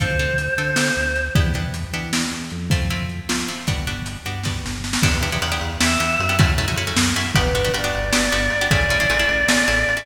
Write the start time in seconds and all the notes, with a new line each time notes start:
0.00 D2 C4 D4 F4 A4 C5, kick, closed hi-hat
0.19 C4 D4 F4 A4, closed hi-hat
0.38 closed hi-hat
0.58 D3 C4 D4 F4 A4, closed hi-hat
0.76 C4 D4 F4 A4, snare
0.97 D2, closed hi-hat
1.16 closed hi-hat
1.35 E2 B3 D4 E4 G4, kick, closed hi-hat
1.54 B3 D4 E4 G4, closed hi-hat
1.74 closed hi-hat
1.93 E3 B3 D4 E4 G4, closed hi-hat
2.13 B3 D4 E4 G4, snare
2.31 E2, closed hi-hat
2.50 F2, closed hi-hat
2.70 A3 C4 E4 F4, kick, closed hi-hat
2.90 A3 C4 E4 F4, closed hi-hat
3.09 closed hi-hat
3.29 F3 A3 C4 E4 F4, snare
3.48 A3 C4 E4 F4, closed hi-hat
3.67 G1 G3 B3 D4 F#4, kick, closed hi-hat
3.87 G3 B3 D4 F#4, closed hi-hat
4.06 closed hi-hat
4.25 G2 G3 B3 D4 F#4, closed hi-hat
4.43 G3 B3 D4 F#4, kick, snare
4.64 G1, snare
4.84 snare
4.93 snare
5.03 E2 B3 D4 E4 G4, kick, crash
5.21 E2 B3 D4 E4 G4, ride
5.32 B3 D4 E4 G4
5.42 E2 B3 D4 E4 G4, ride
5.52 B3 D4 E4 G4
5.61 E2, ride
5.80 E2 B3 D4 E4 G4 E5, snare
6.00 E2 B3 D4 E4 G4, ride
6.20 F#2, ride
6.29 B3 D4 E4 G4
6.39 A3 C#4 E4 F#4, kick, ride
6.57 F#2 A3 C#4 E4 F#4, ride
6.68 A3 C#4 E4 F#4
6.76 F#2 A3 C#4 E4 F#4, ride
6.87 A3 C#4 E4 F#4
6.97 F#2, snare
7.16 F#2 A3 C#4 E4 F#4, ride
7.35 G1 B3 D4 F#4 G4 B4, kick, ride
7.55 G1 B3 D4 F#4 G4, ride
7.65 B3 D4 F#4 G4
7.74 G1 B3 D4 F#4 G4 D5, ride
7.84 B3 D4 F#4 G4
7.95 G1, ride
8.13 G1 B3 D4 F#4 G4, snare
8.32 G1 B3 D4 F#4 G4, ride
8.50 G1, ride
8.61 B3 D4 F#4 G4
8.70 A1 A3 C#4 E4 G#4 D5, kick, ride
8.89 A1 A3 C#4 E4 G#4, ride
9.00 A3 C#4 E4 G#4
9.10 A1 A3 C#4 E4 G#4, ride
9.19 A3 C#4 E4 G#4
9.29 A1, ride
9.47 A1 A3 C#4 E4 G#4, snare
9.68 A1 A3 C#4 E4 G#4, ride
9.87 A1, ride
9.97 A3 C#4 E4 G#4